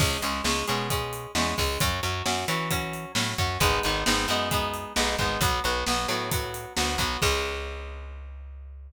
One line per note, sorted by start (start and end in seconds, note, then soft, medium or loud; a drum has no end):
0.00 0.18 C#2 medium
0.00 0.21 G#3 loud
0.00 0.21 C#4 loud
0.00 kick loud
0.00 crash loud
0.22 0.41 C#2 medium
0.22 0.43 G#3 medium
0.22 0.43 C#4 medium
0.22 closed hi-hat loud
0.44 0.64 C#2 medium
0.44 0.66 G#3 medium
0.44 0.66 C#4 medium
0.44 snare loud
0.68 1.27 B2 medium
0.68 0.88 G#3 medium
0.68 0.88 C#4 loud
0.68 closed hi-hat medium
0.90 1.32 G#3 loud
0.90 1.32 C#4 medium
0.90 kick loud
0.90 closed hi-hat loud
1.13 closed hi-hat medium
1.35 1.54 E2 medium
1.35 1.56 G#3 medium
1.35 1.56 C#4 medium
1.35 snare loud
1.58 1.78 C#2 medium
1.58 1.79 G#3 loud
1.58 1.79 C#4 medium
1.58 kick loud
1.58 open hi-hat medium
1.80 2.00 F#2 medium
1.80 2.01 F#3 loud
1.80 2.01 C#4 loud
1.80 kick loud
1.80 closed hi-hat loud
2.03 2.22 F#2 medium
2.03 2.24 F#3 medium
2.03 2.24 C#4 medium
2.03 closed hi-hat medium
2.26 2.45 F#2 medium
2.26 2.46 F#3 loud
2.26 2.46 C#4 medium
2.26 snare loud
2.48 3.06 E3 medium
2.48 2.69 F#3 medium
2.48 2.69 C#4 medium
2.48 closed hi-hat medium
2.70 3.12 F#3 loud
2.70 3.12 C#4 loud
2.70 kick loud
2.70 closed hi-hat loud
2.93 closed hi-hat medium
3.15 3.34 A2 medium
3.15 3.37 F#3 medium
3.15 3.37 C#4 medium
3.15 snare loud
3.38 3.58 F#2 medium
3.38 3.59 F#3 medium
3.38 3.59 C#4 medium
3.38 kick loud
3.38 closed hi-hat medium
3.60 3.79 G#1 medium
3.60 3.82 G#3 loud
3.60 3.82 B3 loud
3.60 3.82 D#4 loud
3.60 kick loud
3.60 closed hi-hat loud
3.83 4.04 G#1 medium
3.83 4.04 G#3 medium
3.83 4.04 B3 loud
3.83 4.04 D#4 loud
3.83 closed hi-hat medium
4.06 4.26 G#1 medium
4.06 4.27 G#3 medium
4.06 4.27 B3 medium
4.06 4.27 D#4 loud
4.06 snare loud
4.28 4.85 F#2 medium
4.28 4.49 G#3 loud
4.28 4.49 B3 loud
4.28 4.49 D#4 loud
4.28 closed hi-hat medium
4.51 4.93 G#3 loud
4.51 4.93 B3 medium
4.51 4.93 D#4 loud
4.51 kick loud
4.51 closed hi-hat loud
4.74 closed hi-hat medium
4.96 5.16 B1 medium
4.96 5.17 G#3 medium
4.96 5.17 B3 loud
4.96 5.17 D#4 medium
4.96 snare loud
5.18 5.38 G#1 medium
5.18 5.40 G#3 medium
5.18 5.40 B3 medium
5.18 5.40 D#4 loud
5.18 kick medium
5.18 closed hi-hat medium
5.41 5.60 B1 medium
5.41 5.62 F#3 loud
5.41 5.62 B3 loud
5.41 kick loud
5.41 closed hi-hat loud
5.64 5.84 B1 medium
5.64 5.85 F#3 medium
5.64 5.85 B3 loud
5.64 closed hi-hat medium
5.86 6.07 B1 medium
5.86 6.07 F#3 medium
5.86 6.07 B3 loud
5.86 snare loud
6.08 6.66 A2 medium
6.08 6.30 F#3 loud
6.08 6.30 B3 medium
6.08 closed hi-hat medium
6.31 6.73 F#3 loud
6.31 6.73 B3 medium
6.31 kick loud
6.31 closed hi-hat loud
6.54 closed hi-hat medium
6.77 6.97 D2 medium
6.77 6.97 F#3 loud
6.77 6.97 B3 medium
6.77 snare loud
6.98 7.17 B1 medium
6.98 7.20 F#3 loud
6.98 7.20 B3 loud
6.98 kick medium
6.98 closed hi-hat loud
7.22 8.91 C#2 loud
7.22 8.90 G#3 loud
7.22 8.90 C#4 loud
7.22 kick loud
7.22 crash loud